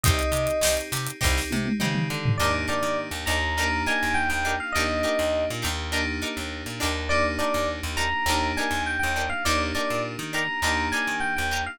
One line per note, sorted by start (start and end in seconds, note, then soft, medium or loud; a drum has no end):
0.03 0.22 C2 loud
0.03 0.57 C4 medium
0.03 0.57 D#4 loud
0.03 0.52 D#4 medium
0.03 0.57 G4 medium
0.03 0.52 G4 medium
0.03 0.52 C5 medium
0.03 0.74 D#5 loud
0.03 kick loud
0.03 closed hi-hat loud
0.19 closed hi-hat medium
0.32 0.48 C3 medium
0.32 closed hi-hat medium
0.47 closed hi-hat medium
0.61 0.77 C2 medium
0.61 1.16 C4 medium
0.61 1.16 D#4 medium
0.61 1.10 D#4 medium
0.61 1.16 G4 medium
0.61 1.10 G4 medium
0.61 1.10 C5 medium
0.61 snare loud
0.77 snare soft
0.77 closed hi-hat medium
0.92 1.08 C3 medium
0.92 snare medium
0.92 closed hi-hat medium
1.06 closed hi-hat medium
1.21 1.40 C2 loud
1.21 1.74 C4 medium
1.21 1.68 D#4 medium
1.21 1.74 D#4 medium
1.21 1.68 G4 loud
1.21 1.74 G4 medium
1.21 1.68 C5 medium
1.21 kick medium
1.21 snare medium
1.37 snare medium
1.51 1.68 C3 medium
1.51 high tom medium
1.66 high tom medium
1.80 2.07 C#3 medium
1.80 2.33 C4 medium
1.80 2.27 D#4 medium
1.80 2.33 D#4 medium
1.80 2.27 G4 medium
1.80 2.33 G4 medium
1.80 2.27 C5 medium
1.80 mid tom medium
1.95 mid tom medium
2.10 2.37 D3 medium
2.25 floor tom loud
2.38 2.66 D#2 medium
2.38 3.54 A#3 medium
2.38 3.54 D4 medium
2.38 2.50 D4 medium
2.38 3.54 D#4 medium
2.38 2.50 D#4 medium
2.38 3.54 G4 medium
2.38 2.50 G4 medium
2.38 2.50 A#4 medium
2.38 2.52 D5 loud
2.68 2.88 D4 medium
2.68 2.88 D#4 medium
2.68 2.88 G4 medium
2.68 2.88 A#4 medium
2.68 2.96 D5 medium
2.83 3.09 D#3 medium
3.11 3.25 D#2 medium
3.26 3.83 D#2 loud
3.26 3.37 D4 medium
3.26 3.37 D#4 medium
3.26 3.37 G4 medium
3.26 3.37 A#4 medium
3.26 3.82 A#5 loud
3.57 4.72 A#3 medium
3.57 4.72 D4 medium
3.57 3.68 D4 medium
3.57 4.72 D#4 medium
3.57 3.68 D#4 medium
3.57 4.72 G4 medium
3.57 3.68 G4 medium
3.57 3.68 A#4 medium
3.86 4.07 D4 medium
3.86 4.07 D#4 medium
3.86 4.07 G4 medium
3.86 4.07 A#4 medium
3.86 4.14 G#5 loud
4.03 4.29 D#2 medium
4.14 4.28 G5 loud
4.29 4.56 D#2 medium
4.29 4.54 G5 loud
4.45 4.55 D4 medium
4.45 4.55 D#4 medium
4.45 4.55 G4 medium
4.45 4.55 A#4 medium
4.60 4.74 F5 medium
4.72 5.02 D#2 medium
4.72 5.90 A#3 medium
4.72 5.90 D4 medium
4.72 4.86 D4 medium
4.72 5.90 D#4 medium
4.72 4.86 D#4 medium
4.72 5.90 G4 medium
4.72 5.44 D#5 loud
4.77 4.86 G4 medium
4.77 4.86 A#4 medium
5.03 5.24 D4 medium
5.03 5.24 D#4 medium
5.03 5.24 G4 medium
5.03 5.24 A#4 medium
5.19 5.45 D#2 medium
5.50 5.64 A#2 medium
5.62 6.20 D#2 loud
5.62 5.72 D4 medium
5.62 5.72 D#4 medium
5.62 5.72 G4 medium
5.62 5.72 A#4 medium
5.92 7.08 A#3 medium
5.92 6.02 D4 medium
5.92 7.08 D4 medium
5.92 7.08 D#4 medium
5.92 6.02 D#4 medium
5.92 7.08 G4 medium
5.92 6.02 G4 medium
5.92 6.02 A#4 medium
6.22 6.42 D4 medium
6.22 6.42 D#4 medium
6.22 6.42 G4 medium
6.22 6.42 A#4 medium
6.37 6.63 D#2 medium
6.66 6.80 A#2 medium
6.80 7.39 D#2 medium
6.80 7.20 D4 medium
6.80 7.20 D#4 medium
6.80 7.20 G4 medium
6.80 7.20 A#4 medium
7.09 8.25 A#3 medium
7.09 8.25 D4 medium
7.09 8.25 D#4 medium
7.09 8.25 G4 medium
7.09 7.23 D5 loud
7.38 7.59 D4 medium
7.38 7.59 D#4 medium
7.38 7.59 G4 medium
7.38 7.59 A#4 medium
7.38 7.67 D5 loud
7.54 7.81 D#2 medium
7.83 8.10 D#2 medium
7.97 8.07 D4 medium
7.97 8.07 D#4 medium
7.97 8.07 G4 medium
7.97 8.07 A#4 medium
7.97 8.47 A#5 loud
8.26 8.52 D#2 loud
8.26 9.43 A#3 medium
8.26 9.43 D4 medium
8.26 8.39 D4 medium
8.26 9.43 D#4 medium
8.26 8.39 D#4 medium
8.26 9.43 G4 medium
8.26 8.39 G4 medium
8.30 8.39 A#4 medium
8.57 8.78 D4 medium
8.57 8.78 D#4 medium
8.57 8.78 G4 medium
8.57 8.78 A#4 medium
8.57 8.81 G#5 medium
8.71 8.97 D#2 medium
8.86 8.99 G5 medium
8.99 9.24 G5 medium
9.03 9.30 D#2 medium
9.16 9.26 D4 medium
9.16 9.26 D#4 medium
9.16 9.26 G4 medium
9.16 9.26 A#4 medium
9.29 9.43 F5 loud
9.45 9.72 D#2 medium
9.45 10.60 A#3 medium
9.45 10.60 D4 medium
9.45 9.56 D4 medium
9.45 10.60 D#4 medium
9.45 9.56 D#4 medium
9.45 10.60 G4 medium
9.45 9.56 G4 medium
9.45 9.56 A#4 medium
9.45 9.59 D5 loud
9.75 9.95 D4 medium
9.75 9.95 D#4 medium
9.75 9.95 G4 medium
9.75 9.95 A#4 medium
9.75 10.00 D5 medium
9.90 10.17 A#2 medium
10.19 10.45 D#3 medium
10.33 10.43 D4 medium
10.33 10.43 D#4 medium
10.33 10.43 G4 medium
10.33 10.43 A#4 medium
10.33 10.87 A#5 loud
10.62 10.89 D#2 medium
10.62 11.78 A#3 medium
10.62 11.78 D4 medium
10.62 10.73 D4 medium
10.62 11.78 D#4 medium
10.62 10.73 D#4 medium
10.62 11.78 G4 medium
10.62 10.73 G4 medium
10.62 10.73 A#4 medium
10.92 11.13 D4 medium
10.92 11.13 D#4 medium
10.92 11.13 G4 medium
10.92 11.13 A#4 medium
10.92 11.16 G#5 loud
11.07 11.34 D#3 medium
11.20 11.34 G5 loud
11.36 11.65 D#2 medium
11.36 11.61 G5 medium
11.51 11.62 D4 medium
11.51 11.62 D#4 medium
11.51 11.62 G4 medium
11.51 11.62 A#4 medium
11.66 11.79 F5 loud